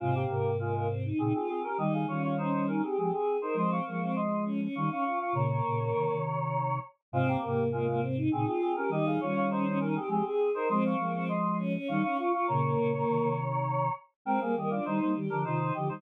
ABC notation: X:1
M:3/4
L:1/16
Q:1/4=101
K:Fm
V:1 name="Choir Aahs"
[A,F] [B,G]3 [A,F]2 z2 [CA] [CA] [CA] [DB] | [Ge] [Af] [Fd] [Fd] [Ec]2 [DB] [CA] [CA] [CA]2 [Ec] | [ec'] [fd']3 [ec']2 z2 [fd'] [fd'] [fd'] [fd'] | [db]10 z2 |
[A,F] [B,G]3 [A,F]2 z2 [CA] [CA] [CA] [DB] | [Ge] [Af] [Fd] [Fd] [Ec]2 [DB] [CA] [CA] [CA]2 [Ec] | [ec'] [fd']3 [ec']2 z2 [fd'] [fd'] [fd'] [fd'] | [db]10 z2 |
[K:Cm] [Bg] [Af] [Ge] [Fd] [Ec] [Ec] z [DB] [Ec]2 [Ge] [Ec] |]
V:2 name="Choir Aahs"
C2 B,2 B, B, C E E F2 G | E2 D2 D D E G G A2 B | C2 B, C z2 D D E D F F | B, B,2 B,3 z6 |
C2 B,2 B, B, C E E F2 G | E2 D2 D D E G G A2 B | C2 B, C z2 D D E D F F | B, B,2 B,3 z6 |
[K:Cm] C B, B, D E2 G2 F E G E |]
V:3 name="Flute"
[A,,C,]2 [A,,C,]6 [B,,D,] z3 | [E,G,]2 [E,G,]6 [F,A,] z3 | [F,A,]2 [F,A,]6 [E,G,] z3 | [B,,D,]2 [B,,D,]2 [C,E,] [C,E,]5 z2 |
[A,,C,]2 [A,,C,]6 [B,,D,] z3 | [E,G,]2 [E,G,]6 [F,A,] z3 | [F,A,]2 [F,A,]6 [E,G,] z3 | [B,,D,]2 [B,,D,]2 [C,E,] [C,E,]5 z2 |
[K:Cm] [A,C] [G,B,] [E,G,]2 [E,G,] [G,B,] [E,G,] [D,F,] [C,E,]2 [D,F,] [E,G,] |]